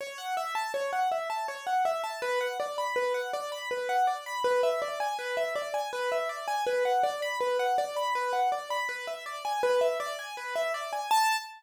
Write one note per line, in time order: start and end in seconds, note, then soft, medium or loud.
0.01 0.18 C#5 medium
0.18 0.35 F#5 medium
0.37 0.54 E5 medium
0.55 0.72 A5 medium
0.74 0.91 C#5 medium
0.93 1.10 F#5 medium
1.12 1.29 E5 soft
1.30 1.47 A5 medium
1.48 1.65 C#5 medium
1.67 1.84 F#5 medium
1.85 2.02 E5 medium
2.04 2.21 A5 medium
2.22 2.39 B4 medium
2.41 2.58 F#5 medium
2.60 2.77 D5 medium
2.78 2.95 B5 medium
2.96 3.13 B4 medium
3.14 3.31 F#5 medium
3.33 3.50 D5 medium
3.52 3.69 B5 medium
3.71 3.88 B4 medium
3.89 4.06 F#5 medium
4.07 4.24 D5 medium
4.26 4.43 B5 medium
4.44 4.61 B4 medium
4.63 4.80 E5 medium
4.82 4.99 D5 medium
5.00 5.17 G#5 medium
5.19 5.36 B4 medium
5.37 5.54 E5 medium
5.56 5.73 D5 medium
5.74 5.91 G#5 medium
5.93 6.10 B4 medium
6.12 6.29 E5 medium
6.29 6.46 D5 medium
6.48 6.65 G#5 medium
6.67 6.83 B4 medium
6.85 7.02 F#5 medium
7.03 7.20 D5 medium
7.22 7.39 B5 medium
7.40 7.58 B4 medium
7.59 7.76 F#5 medium
7.78 7.95 D5 medium
7.96 8.13 B5 medium
8.15 8.32 B4 medium
8.33 8.50 F#5 medium
8.52 8.69 D5 medium
8.70 8.88 B5 medium
8.89 9.06 B4 medium
9.07 9.24 E5 medium
9.26 9.43 D5 medium
9.45 9.62 G#5 medium
9.63 9.80 B4 medium
9.81 9.98 E5 medium
10.00 10.17 D5 medium
10.19 10.36 G#5 medium
10.37 10.54 B4 medium
10.56 10.73 E5 medium
10.74 10.91 D5 medium
10.93 11.10 G#5 medium
11.11 11.37 A5 loud